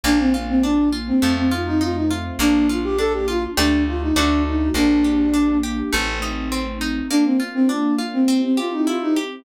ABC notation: X:1
M:4/4
L:1/16
Q:1/4=102
K:Bb
V:1 name="Flute"
D C z C D2 z C2 C F E F E z2 | D2 F G A G F z D2 F E D2 E2 | D6 z10 | D C z C D2 z C2 C F E F E z2 |]
V:2 name="Orchestral Harp"
B,2 F2 D2 F2 A,2 F2 E2 F2 | B,2 F2 D2 F2 [A,DG]4 [A,D^F]4 | B,2 G2 D2 G2 A,2 E2 C2 E2 | B,2 F2 D2 F2 C2 G2 =E2 G2 |]
V:3 name="Electric Bass (finger)" clef=bass
B,,,8 F,,8 | B,,,8 D,,4 D,,4 | B,,,8 A,,,8 | z16 |]
V:4 name="String Ensemble 1"
[B,DF]8 [A,CEF]8 | [B,DF]8 [A,DG]4 [A,D^F]4 | [B,DG]8 [A,CE]8 | [B,DF]8 [C=EG]8 |]